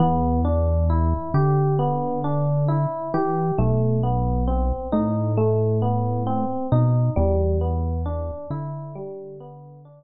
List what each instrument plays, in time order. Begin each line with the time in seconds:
0.00 synth bass 1 E2, electric piano 1 B3
0.45 electric piano 1 D4
0.90 electric piano 1 E4
1.34 synth bass 1 D3, electric piano 1 G4
1.79 electric piano 1 B3
2.24 electric piano 1 D4
2.68 electric piano 1 E4
3.14 synth bass 1 E3, electric piano 1 G4
3.58 synth bass 1 B1, electric piano 1 A3
4.03 electric piano 1 B3
4.48 electric piano 1 C4
4.92 synth bass 1 A2, electric piano 1 D#4
5.37 electric piano 1 A3
5.82 electric piano 1 B3
6.27 electric piano 1 C4
6.72 synth bass 1 B2, electric piano 1 D#4
7.16 synth bass 1 E2, electric piano 1 G3
7.61 electric piano 1 B3
8.06 electric piano 1 D4
8.50 synth bass 1 D3, electric piano 1 E4
8.95 electric piano 1 G3
9.40 electric piano 1 B3
9.85 electric piano 1 D4